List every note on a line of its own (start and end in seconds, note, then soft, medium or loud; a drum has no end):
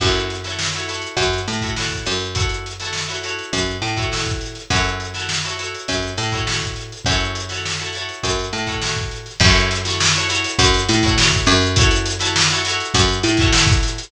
0.00 1.01 F#2 medium
0.00 0.35 E4 loud
0.00 0.35 F#4 medium
0.00 0.35 A4 medium
0.00 0.35 C#5 medium
0.00 kick loud
0.00 crash loud
0.15 closed hi-hat medium
0.30 closed hi-hat medium
0.44 0.68 E4 medium
0.44 0.68 F#4 medium
0.44 0.68 A4 medium
0.44 0.68 C#5 medium
0.44 snare medium
0.44 closed hi-hat medium
0.59 snare loud
0.73 0.86 E4 medium
0.73 0.86 F#4 medium
0.73 0.86 A4 medium
0.73 0.86 C#5 medium
0.73 closed hi-hat medium
0.88 1.35 E4 medium
0.88 1.35 F#4 medium
0.88 1.35 A4 medium
0.88 1.35 C#5 medium
0.88 closed hi-hat medium
1.02 closed hi-hat medium
1.17 1.42 F#2 medium
1.17 kick medium
1.17 closed hi-hat loud
1.33 closed hi-hat medium
1.48 2.04 A2 medium
1.48 snare soft
1.48 closed hi-hat medium
1.61 1.74 E4 medium
1.61 1.74 F#4 medium
1.61 1.74 A4 medium
1.61 1.74 C#5 medium
1.61 kick medium
1.61 closed hi-hat medium
1.76 2.24 E4 medium
1.76 2.24 F#4 medium
1.76 2.24 A4 medium
1.76 2.24 C#5 medium
1.76 snare loud
1.90 kick medium
1.90 closed hi-hat medium
2.06 3.36 F#2 medium
2.06 closed hi-hat medium
2.20 closed hi-hat medium
2.35 2.70 E4 medium
2.35 2.70 F#4 medium
2.35 2.70 A4 medium
2.35 2.70 C#5 medium
2.35 kick loud
2.35 closed hi-hat loud
2.49 closed hi-hat medium
2.66 closed hi-hat medium
2.80 3.03 E4 medium
2.80 3.03 F#4 medium
2.80 3.03 A4 loud
2.80 3.03 C#5 medium
2.80 snare medium
2.80 closed hi-hat medium
2.93 snare loud
3.08 3.20 E4 medium
3.08 3.20 F#4 medium
3.08 3.20 A4 medium
3.08 3.20 C#5 medium
3.08 closed hi-hat medium
3.23 3.70 E4 medium
3.23 3.70 F#4 medium
3.23 3.70 A4 medium
3.23 3.70 C#5 medium
3.23 closed hi-hat medium
3.39 closed hi-hat medium
3.53 3.78 F#2 medium
3.53 kick medium
3.53 closed hi-hat loud
3.66 closed hi-hat medium
3.82 4.57 A2 medium
3.82 closed hi-hat medium
3.97 4.08 E4 medium
3.97 4.08 F#4 medium
3.97 4.08 A4 medium
3.97 4.08 C#5 medium
3.97 kick medium
3.97 closed hi-hat medium
4.12 4.59 E4 medium
4.12 4.59 F#4 medium
4.12 4.59 A4 medium
4.12 4.59 C#5 medium
4.12 snare loud
4.25 kick medium
4.25 closed hi-hat medium
4.41 snare soft
4.41 closed hi-hat medium
4.55 closed hi-hat medium
4.70 5.70 F#2 medium
4.70 5.06 E4 medium
4.70 5.06 F#4 loud
4.70 5.06 A4 loud
4.70 5.06 C#5 loud
4.70 kick loud
4.70 closed hi-hat loud
4.84 closed hi-hat medium
5.00 closed hi-hat medium
5.14 5.38 E4 medium
5.14 5.38 F#4 medium
5.14 5.38 A4 medium
5.14 5.38 C#5 medium
5.14 snare medium
5.14 closed hi-hat medium
5.29 snare loud
5.44 5.56 E4 medium
5.44 5.56 F#4 medium
5.44 5.56 A4 medium
5.44 5.56 C#5 medium
5.44 closed hi-hat medium
5.59 6.06 E4 medium
5.59 6.06 F#4 medium
5.59 6.06 A4 medium
5.59 6.06 C#5 medium
5.59 closed hi-hat medium
5.74 closed hi-hat medium
5.88 6.14 F#2 medium
5.88 kick medium
5.88 closed hi-hat loud
6.02 closed hi-hat medium
6.17 6.93 A2 medium
6.17 closed hi-hat medium
6.32 6.44 E4 medium
6.32 6.44 F#4 medium
6.32 6.44 A4 medium
6.32 6.44 C#5 medium
6.32 kick medium
6.32 closed hi-hat medium
6.47 6.94 E4 medium
6.47 6.94 F#4 medium
6.47 6.94 A4 medium
6.47 6.94 C#5 medium
6.47 snare loud
6.62 kick medium
6.62 closed hi-hat medium
6.76 closed hi-hat medium
6.92 closed hi-hat medium
7.05 8.06 F#2 medium
7.05 7.42 E4 medium
7.05 7.42 F#4 medium
7.05 kick loud
7.05 closed hi-hat loud
7.09 7.42 A4 loud
7.09 7.42 C#5 loud
7.20 closed hi-hat medium
7.35 closed hi-hat medium
7.49 7.73 E4 medium
7.49 7.73 F#4 medium
7.49 7.73 A4 medium
7.49 7.73 C#5 medium
7.49 snare medium
7.49 closed hi-hat medium
7.65 snare loud
7.79 7.91 E4 medium
7.79 7.91 F#4 medium
7.79 7.91 A4 medium
7.79 7.91 C#5 medium
7.79 closed hi-hat medium
7.93 8.41 E4 medium
7.93 8.41 F#4 medium
7.93 8.41 A4 medium
7.93 closed hi-hat medium
7.97 8.41 C#5 medium
8.09 closed hi-hat medium
8.23 8.49 F#2 medium
8.23 kick medium
8.23 closed hi-hat loud
8.39 closed hi-hat medium
8.53 9.28 A2 medium
8.53 closed hi-hat medium
8.67 8.78 E4 medium
8.67 8.78 F#4 medium
8.67 8.78 A4 medium
8.67 8.78 C#5 medium
8.67 kick medium
8.67 closed hi-hat medium
8.82 9.29 E4 medium
8.82 9.29 F#4 medium
8.82 9.29 A4 medium
8.82 9.29 C#5 medium
8.82 snare loud
8.97 kick medium
8.97 closed hi-hat medium
9.11 closed hi-hat medium
9.26 snare soft
9.26 closed hi-hat medium
9.40 10.40 F#2 loud
9.40 9.77 E4 loud
9.40 9.77 F#4 loud
9.40 9.77 A4 loud
9.40 kick loud
9.40 crash loud
9.44 9.77 C#5 loud
9.55 closed hi-hat medium
9.71 closed hi-hat loud
9.85 10.08 E4 loud
9.85 10.08 F#4 medium
9.85 10.08 A4 loud
9.85 10.08 C#5 loud
9.85 snare medium
9.85 closed hi-hat loud
10.00 snare loud
10.14 10.27 E4 loud
10.14 10.27 F#4 medium
10.14 10.27 A4 medium
10.14 10.27 C#5 loud
10.14 closed hi-hat medium
10.29 10.76 E4 loud
10.29 10.76 F#4 loud
10.29 10.76 A4 loud
10.29 10.76 C#5 loud
10.29 closed hi-hat loud
10.44 closed hi-hat loud
10.59 10.84 F#2 loud
10.59 kick loud
10.59 closed hi-hat loud
10.74 closed hi-hat loud
10.89 11.45 A2 medium
10.89 snare medium
10.89 closed hi-hat loud
11.03 11.15 E4 loud
11.03 11.15 F#4 loud
11.03 11.15 A4 loud
11.03 11.15 C#5 loud
11.03 kick loud
11.03 closed hi-hat loud
11.18 11.66 E4 loud
11.18 11.66 F#4 loud
11.18 11.66 A4 loud
11.18 11.66 C#5 loud
11.18 snare loud
11.31 kick loud
11.31 closed hi-hat medium
11.46 12.76 F#2 loud
11.46 closed hi-hat loud
11.62 closed hi-hat medium
11.76 12.12 E4 loud
11.76 12.12 F#4 loud
11.76 12.12 A4 loud
11.76 12.12 C#5 loud
11.76 kick loud
11.76 closed hi-hat loud
11.91 closed hi-hat loud
12.06 closed hi-hat loud
12.19 12.43 E4 loud
12.19 12.43 F#4 loud
12.19 12.43 A4 loud
12.19 12.43 C#5 loud
12.19 snare medium
12.19 closed hi-hat loud
12.36 snare loud
12.50 12.62 E4 loud
12.50 12.62 F#4 loud
12.50 12.62 A4 loud
12.50 12.62 C#5 loud
12.50 closed hi-hat medium
12.65 13.13 E4 loud
12.65 13.13 F#4 loud
12.65 13.13 A4 loud
12.65 13.13 C#5 loud
12.65 closed hi-hat loud
12.80 closed hi-hat medium
12.94 13.19 F#2 loud
12.94 kick loud
12.94 closed hi-hat loud
13.08 closed hi-hat medium
13.23 13.99 A2 medium
13.23 closed hi-hat loud
13.37 13.51 E4 loud
13.37 13.51 F#4 loud
13.37 13.51 A4 loud
13.37 kick loud
13.37 closed hi-hat loud
13.42 13.51 C#5 loud
13.52 13.99 E4 loud
13.52 13.99 F#4 medium
13.52 13.99 A4 loud
13.52 13.99 C#5 loud
13.52 snare loud
13.67 kick loud
13.67 closed hi-hat loud
13.82 snare soft
13.82 closed hi-hat loud
13.98 closed hi-hat loud